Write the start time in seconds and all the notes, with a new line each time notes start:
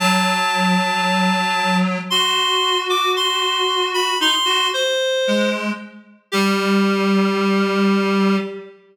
0.00 F#3 A5
2.10 F#4 C6
2.90 D6
3.16 C6
3.94 B5
4.20 D#4 C6
4.45 F#4
4.74 C5
5.27 G#3
6.32 G3 G4